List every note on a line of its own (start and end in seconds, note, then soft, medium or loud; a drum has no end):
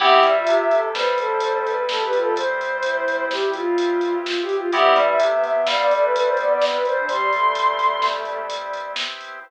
0.00 0.20 C2 loud
0.00 0.21 B3 loud
0.00 4.69 B3 medium
0.00 0.21 C4 loud
0.00 4.69 C4 medium
0.00 0.21 E4 medium
0.00 4.69 E4 medium
0.00 0.21 G4 loud
0.00 0.32 G4 loud
0.00 4.69 G4 medium
0.00 0.77 E5 medium
0.00 kick loud
0.00 crash loud
0.23 0.43 G2 medium
0.23 0.44 G3 medium
0.23 closed hi-hat medium
0.35 0.64 F4 medium
0.47 0.88 C2 medium
0.47 0.88 C3 medium
0.47 closed hi-hat loud
0.71 0.90 A4 loud
0.71 closed hi-hat medium
0.94 4.16 G2 medium
0.94 4.15 G3 medium
0.94 1.16 B4 medium
0.94 1.62 C5 medium
0.94 snare loud
1.18 1.76 A4 medium
1.18 closed hi-hat medium
1.40 closed hi-hat loud
1.65 1.86 B4 loud
1.65 closed hi-hat medium
1.89 2.00 A4 medium
1.89 2.04 A4 medium
1.89 snare loud
2.01 2.12 G4 loud
2.01 2.19 B4 medium
2.13 2.34 F4 medium
2.13 closed hi-hat medium
2.20 2.35 A4 medium
2.36 3.25 C5 medium
2.36 kick loud
2.36 closed hi-hat loud
2.61 closed hi-hat medium
2.83 3.27 E4 loud
2.83 closed hi-hat loud
3.08 closed hi-hat medium
3.30 3.51 E4 medium
3.30 3.50 G4 medium
3.30 snare loud
3.53 4.31 F4 loud
3.53 4.13 F4 medium
3.53 closed hi-hat medium
3.78 closed hi-hat loud
4.01 closed hi-hat medium
4.25 4.40 F4 medium
4.25 snare loud
4.41 4.56 G4 medium
4.49 closed hi-hat medium
4.56 4.71 F4 medium
4.72 4.93 C2 medium
4.72 5.15 E3 medium
4.72 5.15 G3 loud
4.72 9.40 B3 medium
4.72 4.94 B3 loud
4.72 9.40 C4 loud
4.72 4.94 C4 medium
4.72 9.40 E4 medium
4.72 4.94 E4 medium
4.72 9.40 G4 medium
4.72 4.94 G4 loud
4.72 5.05 E5 medium
4.72 kick loud
4.72 closed hi-hat loud
4.95 5.17 G2 medium
4.95 5.15 G3 medium
4.95 closed hi-hat medium
5.07 5.42 E5 medium
5.19 5.60 C2 medium
5.19 5.60 C3 medium
5.19 5.31 A3 medium
5.19 closed hi-hat loud
5.31 5.43 B3 loud
5.43 5.86 B3 medium
5.43 5.64 E5 medium
5.43 closed hi-hat medium
5.67 8.88 G2 medium
5.67 8.88 G3 medium
5.67 5.78 F5 medium
5.67 snare loud
5.79 5.90 D5 medium
5.90 6.29 A3 loud
5.90 6.01 D5 medium
5.90 closed hi-hat medium
6.02 6.13 B4 medium
6.15 6.26 B4 medium
6.15 closed hi-hat loud
6.26 6.37 C5 medium
6.37 6.71 B3 loud
6.37 6.49 D5 medium
6.37 closed hi-hat medium
6.50 6.61 D5 medium
6.62 snare loud
6.72 6.83 B4 medium
6.85 7.06 C5 medium
6.85 closed hi-hat medium
6.97 7.08 D4 loud
7.08 7.31 G3 loud
7.08 8.05 C6 medium
7.08 kick loud
7.08 closed hi-hat loud
7.32 8.46 A3 loud
7.32 closed hi-hat medium
7.55 closed hi-hat loud
7.79 closed hi-hat medium
8.02 snare loud
8.25 closed hi-hat medium
8.50 closed hi-hat loud
8.73 closed hi-hat medium
8.96 snare loud
9.21 closed hi-hat medium